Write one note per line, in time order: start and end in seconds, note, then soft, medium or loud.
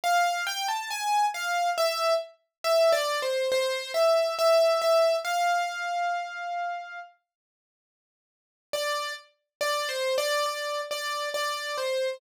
0.04 0.44 F5 loud
0.47 0.67 G5 loud
0.68 0.89 A5 medium
0.90 1.26 G#5 medium
1.34 1.70 F5 medium
1.78 2.14 E5 loud
2.64 2.92 E5 loud
2.92 3.20 D5 loud
3.22 3.50 C5 medium
3.52 3.92 C5 loud
3.94 4.35 E5 medium
4.39 4.81 E5 loud
4.82 5.16 E5 medium
5.24 6.99 F5 medium
8.73 9.13 D5 loud
9.61 9.88 D5 loud
9.89 10.16 C5 medium
10.18 10.45 D5 loud
10.46 10.81 D5 medium
10.91 11.29 D5 medium
11.34 11.76 D5 medium
11.78 12.17 C5 medium